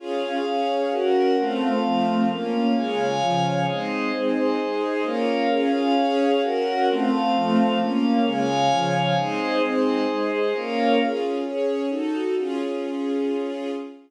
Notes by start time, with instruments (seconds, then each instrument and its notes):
0.00 string ensemble 1 C#4 F4 G#4, pad 5 (bowed) C#4 G#4 F5
0.46 string ensemble 1 C#4 G#4 C#5
0.91 string ensemble 1 C#4 F#4 A#4, pad 5 (bowed) C#4 A#4 F#5
1.38 string ensemble 1 A3 C4 F4, pad 5 (bowed) A3 C4 F5
1.84 string ensemble 1 F3 A3 F4
2.28 string ensemble 1 A#3 C#4 F4, pad 5 (bowed) A#3 C#4 F5
2.75 string ensemble 1 C#3 G#3 F4, pad 5 (bowed) C#5 F5 G#5
3.20 string ensemble 1 C#3 F3 F4
3.66 string ensemble 1 G#3 C4 D#4, pad 5 (bowed) G#4 C5 D#5
4.13 string ensemble 1 G#3 C4 D#4, pad 5 (bowed) G#4 C5 D#5
4.58 string ensemble 1 G#3 D#4 G#4
5.04 string ensemble 1 A#3 C#4 F4, pad 5 (bowed) A#4 C#5 F5
5.49 string ensemble 1 C#4 F4 G#4, pad 5 (bowed) C#4 G#4 F5
5.96 string ensemble 1 C#4 G#4 C#5
6.41 pad 5 (bowed) C#4 A#4 F#5, string ensemble 1 C#4 F#4 A#4
6.88 pad 5 (bowed) A3 C4 F5, string ensemble 1 A3 C4 F4
7.35 string ensemble 1 F3 A3 F4
7.79 pad 5 (bowed) A#3 C#4 F5, string ensemble 1 A#3 C#4 F4
8.24 string ensemble 1 C#3 G#3 F4, pad 5 (bowed) C#5 F5 G#5
8.69 string ensemble 1 C#3 F3 F4
9.16 string ensemble 1 G#3 C4 D#4, pad 5 (bowed) G#4 C5 D#5
9.61 string ensemble 1 G#3 C4 D#4, pad 5 (bowed) G#4 C5 D#5
10.08 string ensemble 1 G#3 D#4 G#4
10.53 string ensemble 1 A#3 C#4 F4, pad 5 (bowed) A#4 C#5 F5
11.00 string ensemble 1 C#4 F4 G#4
11.44 string ensemble 1 C#4 G#4 C#5
11.89 string ensemble 1 D#4 F#4 A4
12.38 string ensemble 1 C#4 F4 G#4